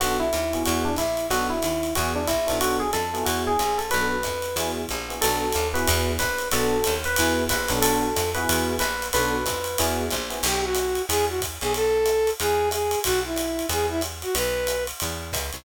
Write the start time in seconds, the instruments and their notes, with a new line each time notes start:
0.00 electric bass (finger) B1, electric piano 1 B3 D4 F#4 A4, ride
0.20 electric piano 1 E4
0.33 electric bass (finger) D#2, hi-hat pedal, ride
0.53 electric piano 1 B3 E4 F#4 G#4, ride
0.65 electric bass (finger) E2, electric piano 1 F#4, ride
0.85 electric piano 1 D4
0.97 electric bass (finger) A#1, electric piano 1 E4, kick, hi-hat pedal, ride
1.17 ride
1.30 electric bass (finger) B1, electric piano 1 B3 D4 F#4 A4, ride
1.50 electric piano 1 E4
1.62 electric bass (finger) D#2, hi-hat pedal, ride
1.83 ride
1.95 electric bass (finger) E2, electric piano 1 B3 E4 F#4 G#4, ride
2.16 electric piano 1 D4
2.27 electric bass (finger) A#1, electric piano 1 E4, kick, hi-hat pedal, ride
2.47 electric bass (finger) B1, electric piano 1 B3 D4 F#4 A4, ride
2.61 electric piano 1 F#4, ride
2.80 electric piano 1 G#4
2.93 electric bass (finger) F2, electric piano 1 A4, hi-hat pedal, ride
3.14 electric piano 1 B3 E4 F#4 G#4, ride
3.25 electric bass (finger) E2, electric piano 1 F#4, ride
3.47 electric piano 1 G#4
3.59 electric bass (finger) A#1, hi-hat pedal, ride
3.78 electric piano 1 A4, ride
3.90 electric bass (finger) B1, electric piano 1 B3 D4 F#4 A4 B4, ride
4.23 electric bass (finger) F2, kick, hi-hat pedal, ride
4.42 ride
4.56 electric bass (finger) E2, electric piano 1 B3 E4 F#4 G#4, ride
4.88 electric bass (finger) A#1, kick, hi-hat pedal, ride
5.09 electric piano 1 B3 E4 F#4 G#4, ride
5.21 electric bass (finger) B1, electric piano 1 B3 D4 F#4 A4, ride
5.52 electric bass (finger) D#2, hi-hat pedal, ride
5.74 electric piano 1 B3 E4 F#4 G#4 B4, ride
5.87 electric bass (finger) E2, ride
6.19 electric bass (finger) A#1, electric piano 1 B4, kick, hi-hat pedal, ride
6.38 ride
6.51 electric bass (finger) B1, electric piano 1 B3 D4 F#4 A4, ride
6.84 electric bass (finger) D#2, hi-hat pedal, ride
7.04 electric piano 1 B4, ride
7.16 electric bass (finger) E2, electric piano 1 B3 E4 F#4 G#4, ride
7.49 electric bass (finger) A#1, electric piano 1 B4, kick, hi-hat pedal, ride
7.68 electric bass (finger) B1, electric piano 1 B3 D4 F#4 A4, ride
7.82 electric piano 1 A4, ride
8.16 electric bass (finger) F2, hi-hat pedal, ride
8.35 electric piano 1 B3 E4 F#4 G#4 B4, ride
8.49 electric bass (finger) E2, ride
8.79 electric bass (finger) A#1, electric piano 1 B4, hi-hat pedal, ride
9.02 ride
9.13 electric bass (finger) B1, electric piano 1 B3 D4 F#4 A4 B4, ride
9.46 electric bass (finger) F2, kick, hi-hat pedal, ride
9.64 ride
9.78 electric bass (finger) E2, electric piano 1 B3 E4 F#4 G#4, ride
10.11 electric bass (finger) A#1, kick, hi-hat pedal, ride
10.30 electric piano 1 B3 E4 F#4 G#4, ride
10.43 electric bass (finger) B1, brass section G4, crash, ride
10.64 brass section F#4
10.75 hi-hat pedal, ride
10.95 ride
11.09 electric bass (finger) E2, brass section G#4, ride
11.29 brass section F#4
11.40 kick, hi-hat pedal, ride
11.61 electric bass (finger) B1, brass section G#4, ride
11.74 brass section A4, ride
12.06 hi-hat pedal, ride
12.27 ride
12.39 electric bass (finger) E2, brass section G#4, ride
12.71 brass section G#4, hi-hat pedal, ride
12.91 ride
13.04 electric bass (finger) B1, brass section F#4, kick, ride
13.25 brass section E4
13.36 hi-hat pedal, ride
13.59 ride
13.69 electric bass (finger) E2, brass section G#4, ride
13.89 brass section E4
14.01 hi-hat pedal, ride
14.22 brass section F#4, ride
14.35 electric bass (finger) B1, brass section B4, ride
14.67 hi-hat pedal, ride
14.87 ride
15.00 electric bass (finger) E2, ride
15.32 electric bass (finger) C#2, kick, hi-hat pedal, ride
15.53 electric bass (finger) C2, ride